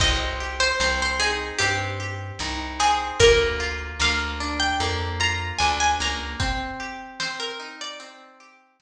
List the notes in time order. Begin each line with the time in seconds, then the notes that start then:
0.00 C2 C4 D#5, kick, crash
0.40 G4
0.60 C5
0.80 C2 C4 C5, snare
1.02 C5
1.20 D#4 G#4
1.59 G2 C4 G4, closed hi-hat
2.00 G4
2.39 C2 D#4, snare
2.80 C4 G#4
3.20 D2 A#3 A#4, kick, closed hi-hat
3.60 F4
4.00 D2 A#3 F5, snare
4.40 D4
4.60 G5
4.80 F2 A#3, closed hi-hat
5.20 F4 A#5
5.58 D2 D4 G#5, snare
5.80 G#5
6.00 C#2 A#3 A#5
6.40 C4, kick, closed hi-hat
6.80 G4
7.20 C4 C5, snare
7.40 A#4
7.60 D#4
7.81 D5
8.00 C4, closed hi-hat
8.40 G4
8.80 D#4, snare